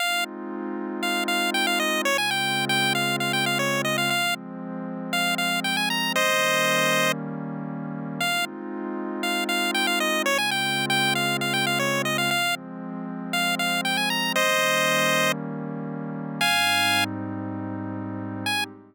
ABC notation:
X:1
M:4/4
L:1/16
Q:1/4=117
K:Ab
V:1 name="Lead 1 (square)"
f2 z6 f2 f2 g f e2 | d a g3 g2 f2 f g f d2 e f | f2 z6 f2 f2 g a b2 | [ce]8 z8 |
f2 z6 f2 f2 g f e2 | d a g3 g2 f2 f g f d2 e f | f2 z6 f2 f2 g a b2 | [ce]8 z8 |
[fa]6 z10 | a4 z12 |]
V:2 name="Pad 2 (warm)"
[A,CEF]16 | [D,A,CF]16 | [F,A,C]16 | [E,G,B,D]16 |
[A,CEF]16 | [D,A,CF]16 | [F,A,C]16 | [E,G,B,D]16 |
[A,,G,CE]16 | [A,CEG]4 z12 |]